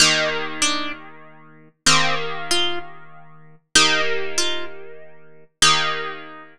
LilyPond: <<
  \new Staff \with { instrumentName = "Orchestral Harp" } { \time 6/8 \key ees \major \tempo 4. = 64 ees'8 r8 d'8 r4. | c'8 r8 f'8 r4. | ees'8 r8 f'8 r4. | ees'4. r4. | }
  \new Staff \with { instrumentName = "Orchestral Harp" } { \time 6/8 \key ees \major <ees bes g'>2. | <ees bes g'>2. | <ees bes g'>2. | <ees bes g'>2. | }
>>